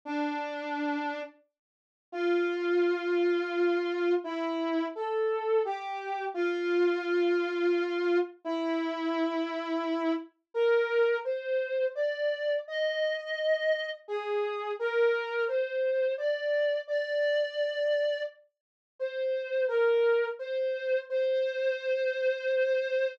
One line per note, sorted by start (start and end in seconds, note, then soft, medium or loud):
0.05 1.20 D4 loud
2.12 4.13 F4 loud
4.24 4.85 E4 loud
4.95 5.61 A4 medium
5.65 6.24 G4 medium
6.34 8.17 F4 loud
8.44 10.13 E4 loud
10.54 11.17 A#4 loud
11.25 11.85 C5 medium
11.95 12.56 D5 medium
12.68 13.89 D#5 loud
14.08 14.71 G#4 medium
14.79 15.44 A#4 loud
15.48 16.12 C5 medium
16.18 16.79 D5 medium
16.88 18.21 D5 loud
18.99 19.64 C5 loud
19.68 20.26 A#4 medium
20.39 20.98 C5 loud
21.10 23.15 C5 loud